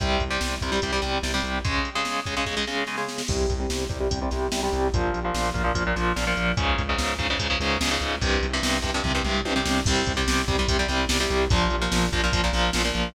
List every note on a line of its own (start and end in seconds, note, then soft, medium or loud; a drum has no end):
0.00 0.18 C2 medium
0.00 0.24 C3 medium
0.00 0.24 G3 medium
0.00 kick loud
0.00 closed hi-hat loud
0.20 0.38 C2 medium
0.20 kick medium
0.20 closed hi-hat medium
0.30 0.55 C3 medium
0.30 0.55 G3 medium
0.41 0.58 C2 medium
0.41 snare loud
0.61 0.79 C2 medium
0.61 0.71 C3 medium
0.61 0.71 G3 medium
0.61 kick medium
0.61 closed hi-hat medium
0.72 0.80 C3 medium
0.72 0.80 G3 medium
0.82 1.00 C2 medium
0.82 0.91 C3 medium
0.82 0.91 G3 medium
0.82 kick medium
0.82 closed hi-hat loud
0.92 1.01 C3 medium
0.92 1.01 G3 medium
1.02 1.20 C2 medium
1.02 1.18 C3 medium
1.02 1.18 G3 medium
1.02 snare medium
1.02 closed hi-hat medium
1.23 1.40 C2 medium
1.23 1.32 C3 medium
1.23 1.32 G3 medium
1.23 snare loud
1.34 1.59 C3 medium
1.34 1.59 G3 medium
1.43 1.61 C2 medium
1.43 closed hi-hat medium
1.65 1.89 C#3 medium
1.65 1.89 G#3 loud
1.65 kick loud
1.65 closed hi-hat loud
1.85 closed hi-hat medium
1.95 2.20 C#3 medium
1.95 2.20 G#3 medium
2.05 snare loud
2.26 2.35 C#3 medium
2.26 2.35 G#3 medium
2.26 kick medium
2.26 closed hi-hat medium
2.37 2.45 C#3 medium
2.37 2.45 G#3 medium
2.46 2.55 C#3 medium
2.46 2.55 G#3 medium
2.46 kick medium
2.46 snare medium
2.57 2.65 C#3 medium
2.57 2.65 G#3 medium
2.67 2.84 C#3 medium
2.67 2.84 G#3 medium
2.67 snare medium
2.87 2.96 C#3 medium
2.87 2.96 G#3 medium
2.87 snare medium
2.97 3.22 C#3 medium
2.97 3.22 G#3 medium
2.97 snare medium
3.08 snare medium
3.18 snare loud
3.28 3.46 C2 medium
3.28 3.53 C3 loud
3.28 3.53 G3 medium
3.28 kick loud
3.28 crash loud
3.49 3.67 C2 medium
3.49 kick medium
3.49 closed hi-hat medium
3.60 3.84 C3 medium
3.60 3.84 G3 medium
3.70 3.87 C2 medium
3.70 snare loud
3.89 4.08 C2 medium
3.89 3.97 C3 medium
3.89 3.97 G3 medium
3.89 kick loud
3.89 closed hi-hat medium
4.00 4.08 C3 medium
4.00 4.08 G3 medium
4.10 4.29 C2 medium
4.10 4.19 C3 medium
4.10 4.19 G3 medium
4.10 kick loud
4.10 closed hi-hat loud
4.22 4.30 C3 medium
4.22 4.30 G3 medium
4.31 4.49 C2 medium
4.31 4.47 C3 medium
4.31 4.47 G3 medium
4.31 snare medium
4.31 closed hi-hat medium
4.52 4.69 C2 medium
4.52 4.60 C3 medium
4.52 4.60 G3 medium
4.52 snare loud
4.63 4.88 C3 medium
4.63 4.88 G3 medium
4.73 4.90 C2 medium
4.73 closed hi-hat medium
4.93 5.11 A#1 medium
4.93 5.19 A#2 medium
4.93 5.19 F3 medium
4.93 kick loud
4.93 closed hi-hat loud
5.14 5.31 A#1 medium
5.14 closed hi-hat medium
5.25 5.49 A#2 medium
5.25 5.49 F3 medium
5.34 5.52 A#1 medium
5.34 snare loud
5.54 5.72 A#1 medium
5.54 5.62 A#2 medium
5.54 5.62 F3 medium
5.54 kick medium
5.54 closed hi-hat medium
5.64 5.72 A#2 medium
5.64 5.72 F3 medium
5.75 5.93 A#1 medium
5.75 5.83 A#2 medium
5.75 5.83 F3 medium
5.75 kick loud
5.75 closed hi-hat loud
5.87 5.95 A#2 medium
5.87 5.95 F3 medium
5.96 6.13 A#1 medium
5.96 6.12 A#2 medium
5.96 6.12 F3 medium
5.96 snare medium
5.96 closed hi-hat medium
6.16 6.34 A#1 medium
6.16 6.24 A#2 medium
6.16 6.24 F3 medium
6.16 snare loud
6.27 6.52 A#2 medium
6.27 6.52 F3 medium
6.37 6.54 A#1 medium
6.37 closed hi-hat medium
6.57 6.75 C#2 medium
6.57 6.82 G#2 loud
6.57 6.82 C#3 medium
6.57 kick loud
6.57 closed hi-hat loud
6.78 6.96 C#2 medium
6.78 kick loud
6.78 closed hi-hat medium
6.89 7.14 G#2 medium
6.89 7.14 C#3 medium
6.98 7.16 C#2 medium
6.98 snare loud
7.19 7.36 C#2 medium
7.19 7.27 G#2 medium
7.19 7.27 C#3 medium
7.19 kick medium
7.19 closed hi-hat medium
7.30 7.38 G#2 medium
7.30 7.38 C#3 medium
7.39 7.57 C#2 medium
7.39 7.47 G#2 medium
7.39 7.47 C#3 medium
7.39 kick loud
7.39 closed hi-hat loud
7.50 7.58 G#2 medium
7.50 7.58 C#3 medium
7.60 7.77 C#2 medium
7.60 7.78 G#2 medium
7.60 7.78 C#3 medium
7.60 snare medium
7.60 closed hi-hat medium
7.81 7.98 C#2 medium
7.81 7.89 G#2 medium
7.81 7.89 C#3 medium
7.81 snare loud
7.91 8.16 G#2 medium
7.91 8.16 C#3 medium
8.01 8.18 C#2 medium
8.01 closed hi-hat medium
8.21 8.39 C2 medium
8.21 8.46 G2 medium
8.21 8.46 C3 medium
8.21 kick loud
8.21 closed hi-hat loud
8.43 8.60 C2 medium
8.43 closed hi-hat medium
8.53 8.78 G2 medium
8.53 8.78 C3 medium
8.63 8.80 C2 medium
8.63 snare loud
8.82 9.01 C2 medium
8.82 8.91 G2 medium
8.82 8.91 C3 medium
8.82 kick medium
8.82 closed hi-hat medium
8.94 9.02 G2 medium
8.94 9.02 C3 medium
9.04 9.22 C2 medium
9.04 9.12 G2 medium
9.04 9.12 C3 medium
9.04 kick medium
9.04 floor tom medium
9.15 9.23 G2 medium
9.15 9.23 C3 medium
9.24 9.42 C2 medium
9.24 9.41 G2 medium
9.24 9.41 C3 medium
9.24 mid tom medium
9.45 9.63 C2 medium
9.45 9.53 G2 medium
9.45 9.53 C3 medium
9.45 high tom loud
9.56 9.80 G2 medium
9.56 9.80 C3 medium
9.65 9.83 C2 medium
9.65 snare loud
9.86 10.04 C2 medium
9.86 10.12 C3 loud
9.86 10.12 G3 loud
9.86 kick loud
9.86 crash loud
10.06 10.24 C2 medium
10.06 kick loud
10.06 closed hi-hat loud
10.17 10.42 C3 loud
10.17 10.42 G3 medium
10.27 10.45 C2 medium
10.27 snare loud
10.48 10.65 C2 medium
10.48 10.56 C3 medium
10.48 10.56 G3 medium
10.48 kick loud
10.48 closed hi-hat medium
10.59 10.67 C3 medium
10.59 10.67 G3 medium
10.68 10.86 C2 medium
10.68 10.77 C3 loud
10.68 10.77 G3 medium
10.68 kick loud
10.68 closed hi-hat loud
10.79 10.87 C3 medium
10.79 10.87 G3 medium
10.88 11.07 C2 medium
10.88 11.05 C3 medium
10.88 11.05 G3 medium
10.88 snare medium
10.88 closed hi-hat loud
11.09 11.27 C2 medium
11.09 11.18 C3 medium
11.09 11.18 G3 medium
11.09 snare loud
11.20 11.45 C3 medium
11.20 11.45 G3 loud
11.30 11.48 C2 medium
11.30 closed hi-hat medium
11.50 11.68 A#1 loud
11.50 11.76 A#2 loud
11.50 11.76 F3 loud
11.50 kick loud
11.50 closed hi-hat loud
11.70 11.89 A#1 medium
11.70 closed hi-hat medium
11.82 12.06 A#2 medium
11.82 12.06 F3 medium
11.92 12.09 A#1 medium
11.92 snare loud
12.13 12.30 A#1 medium
12.13 12.21 A#2 medium
12.13 12.21 F3 medium
12.13 kick loud
12.13 closed hi-hat medium
12.24 12.32 A#2 medium
12.24 12.32 F3 loud
12.33 12.50 A#1 medium
12.33 12.41 A#2 medium
12.33 12.41 F3 medium
12.33 kick loud
12.33 closed hi-hat loud
12.44 12.52 A#2 loud
12.44 12.52 F3 medium
12.53 12.71 A#1 medium
12.53 12.70 A#2 medium
12.53 12.70 F3 medium
12.53 snare medium
12.53 closed hi-hat medium
12.73 12.92 A#1 medium
12.73 12.82 A#2 medium
12.73 12.82 F3 medium
12.73 snare loud
12.85 13.09 A#2 medium
12.85 13.09 F3 medium
12.95 13.12 A#1 medium
12.95 closed hi-hat medium